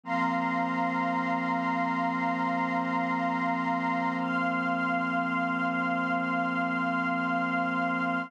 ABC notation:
X:1
M:4/4
L:1/8
Q:1/4=58
K:Flyd
V:1 name="Pad 2 (warm)"
[F,_B,C]8- | [F,_B,C]8 |]
V:2 name="String Ensemble 1"
[f_bc']8 | [fc'f']8 |]